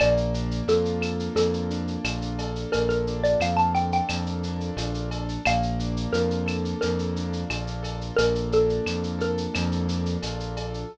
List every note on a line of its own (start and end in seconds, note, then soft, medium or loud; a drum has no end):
0.00 0.62 A#1 loud
0.00 1.35 A#3 loud
0.00 0.63 D5 medium
0.00 cowbell loud
0.00 claves loud
0.00 shaker loud
0.17 shaker medium
0.34 1.70 D4 medium
0.34 shaker loud
0.51 shaker medium
0.67 1.29 F2 medium
0.67 2.05 F4 medium
0.67 1.24 A4 medium
0.67 shaker loud
0.85 shaker medium
1.01 2.40 A4 medium
1.01 claves loud
1.01 shaker loud
1.19 shaker medium
1.35 1.97 F2 medium
1.35 2.73 A#3 medium
1.35 2.27 A4 medium
1.35 cowbell medium
1.35 shaker loud
1.53 shaker medium
1.70 3.07 D4 medium
1.70 shaker medium
1.87 shaker medium
2.04 2.66 A#1 medium
2.04 3.41 F4 medium
2.04 cowbell medium
2.04 claves loud
2.04 shaker loud
2.22 shaker medium
2.38 3.74 A4 medium
2.38 cowbell loud
2.38 shaker medium
2.56 shaker medium
2.72 3.36 A#1 medium
2.72 4.10 A#3 medium
2.72 2.88 A#4 medium
2.72 cowbell loud
2.72 shaker loud
2.89 3.21 A#4 medium
2.89 shaker medium
3.07 4.44 D4 medium
3.07 shaker medium
3.24 3.40 D5 medium
3.24 shaker loud
3.40 4.01 F2 medium
3.40 4.78 F4 medium
3.40 3.58 F5 medium
3.40 claves loud
3.40 shaker loud
3.57 3.73 A5 medium
3.57 shaker medium
3.74 5.11 A4 medium
3.74 3.91 G5 medium
3.74 shaker medium
3.92 4.26 G5 medium
3.92 shaker medium
4.09 4.71 F2 medium
4.09 5.40 A#3 medium
4.09 cowbell medium
4.09 claves loud
4.09 shaker loud
4.26 shaker medium
4.43 5.42 D4 medium
4.43 shaker medium
4.60 shaker medium
4.77 5.38 A#1 medium
4.77 5.43 F4 medium
4.77 cowbell medium
4.77 shaker loud
4.94 shaker medium
5.11 5.43 A4 medium
5.11 cowbell loud
5.11 shaker medium
5.29 shaker medium
5.45 6.07 A#1 medium
5.45 6.81 A#3 loud
5.45 6.12 F5 medium
5.45 cowbell loud
5.45 claves loud
5.45 shaker loud
5.63 shaker medium
5.79 7.17 D4 medium
5.79 shaker medium
5.97 shaker medium
6.12 6.74 F2 medium
6.12 7.50 F4 medium
6.12 6.78 A#4 medium
6.12 shaker loud
6.30 shaker medium
6.46 7.82 A4 medium
6.46 claves loud
6.46 shaker loud
6.65 shaker medium
6.81 7.45 F2 medium
6.81 8.18 A#3 medium
6.81 7.69 A#4 medium
6.81 cowbell medium
6.81 shaker loud
6.99 shaker medium
7.16 8.52 D4 medium
7.16 shaker medium
7.33 shaker medium
7.50 8.11 A#1 medium
7.50 8.86 F4 medium
7.50 cowbell medium
7.50 claves loud
7.50 shaker loud
7.67 shaker medium
7.83 9.18 A4 medium
7.83 cowbell medium
7.83 shaker medium
8.01 shaker medium
8.16 8.80 A#1 medium
8.16 9.53 A#3 medium
8.16 8.49 A#4 loud
8.16 cowbell loud
8.16 shaker loud
8.35 shaker medium
8.52 9.87 D4 medium
8.52 9.14 A4 medium
8.52 shaker medium
8.69 shaker medium
8.86 9.47 F2 medium
8.86 10.22 F4 medium
8.86 claves loud
8.86 shaker loud
9.03 shaker medium
9.19 10.58 A4 medium
9.19 9.86 A#4 medium
9.19 shaker medium
9.37 shaker loud
9.54 10.17 F2 loud
9.54 10.83 A#3 medium
9.54 cowbell loud
9.54 claves loud
9.54 shaker loud
9.72 shaker medium
9.88 10.85 D4 medium
9.88 shaker loud
10.06 shaker medium
10.22 10.84 A#1 medium
10.22 10.87 F4 medium
10.22 cowbell medium
10.22 shaker loud
10.40 shaker medium
10.57 10.91 A4 medium
10.57 cowbell loud
10.57 shaker medium
10.74 shaker medium